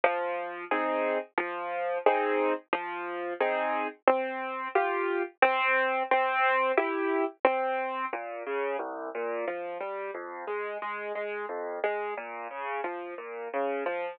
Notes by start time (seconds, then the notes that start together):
0.04 F3
0.71 C4 D#4 G#4
1.38 F3
2.06 C4 D#4 G#4
2.73 F3
3.40 C4 D#4 G#4
4.08 C4
4.75 F4 G4
5.42 C4
6.11 C4
6.78 E4 G4
7.45 C4
8.13 A#2
8.46 C#3
8.79 C2
9.15 A#2
9.48 F3
9.80 G3
10.14 F2
10.47 G#3
10.82 G#3
11.15 G#3
11.49 F2
11.84 G#3
12.17 A#2
12.51 C#3
12.84 F3
13.18 A#2
13.54 C#3
13.86 F3